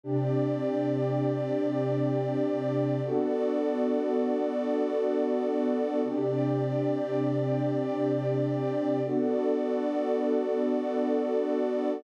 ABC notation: X:1
M:6/8
L:1/8
Q:3/8=80
K:Clyd
V:1 name="Pad 2 (warm)"
[C,DG]6- | [C,DG]6 | [B,DFA]6- | [B,DFA]6 |
[C,DG]6- | [C,DG]6 | [B,DFA]6- | [B,DFA]6 |]
V:2 name="Pad 2 (warm)"
[CGd]6- | [CGd]6 | [B,FAd]6- | [B,FAd]6 |
[CGd]6- | [CGd]6 | [B,FAd]6- | [B,FAd]6 |]